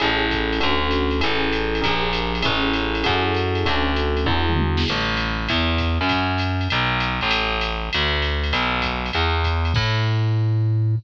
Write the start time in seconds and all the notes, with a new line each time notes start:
0.00 A1 C#4 E4 G#4 A4, ride
0.31 kick, hi-hat pedal, ride
0.53 ride
0.60 D2 C#4 D4 F#4 A4, ride
0.91 hi-hat pedal, ride
1.11 ride
1.20 A1 C#4 E4 G#4 A4, ride
1.53 hi-hat pedal, ride
1.75 ride
1.81 A#1 D4 G4 G#4 A#4, kick, ride
2.13 hi-hat pedal, ride
2.35 ride
2.42 A1 C#4 E4 G#4 A4, kick, ride
2.73 hi-hat pedal, ride
2.95 ride
3.04 F#2 E4 F#4 G#4 A4, kick, ride
3.35 hi-hat pedal, ride
3.55 ride
3.65 D2 C#4 D4 F#4 A4, kick, ride
3.96 hi-hat pedal, ride
4.17 ride
4.26 E2 D4 E4 F#4 G#4, kick
4.49 mid tom
4.57 high tom
4.77 snare
4.86 crash, ride
4.90 A1
5.17 hi-hat pedal, ride
5.49 E2, kick, ride
5.78 kick, hi-hat pedal, ride
6.01 F#2, ride
6.09 kick, ride
6.38 hi-hat pedal, ride
6.61 ride
6.70 B1, ride
7.00 hi-hat pedal, ride
7.21 A1, ride
7.31 ride
7.61 hi-hat pedal, ride
7.93 D2, ride
8.22 ride
8.44 ride
8.53 B1, ride
8.82 kick, hi-hat pedal, ride
9.06 ride
9.13 E2, ride
9.43 kick, hi-hat pedal, ride
9.65 ride
9.74 A2, kick, crash